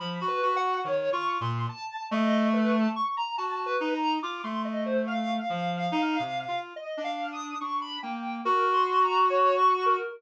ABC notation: X:1
M:4/4
L:1/16
Q:1/4=71
K:none
V:1 name="Clarinet"
F, ^F F2 (3^D,2 =F2 ^A,,2 z2 =A,4 z2 | ^F2 ^D2 =F A,5 F,2 (3D2 C,2 F2 | z D3 D2 ^A,2 ^F8 |]
V:2 name="Ocarina"
(3b2 B2 ^f2 (3^c2 ^c'2 =c'2 a2 ^d2 B a ^c' ^a | (3a2 B2 ^a2 d' c' ^d c f8 | (3^d2 f2 ^d'2 ^c' b g2 (3^A2 =c'2 ^a2 (3^c2 ^c'2 A2 |]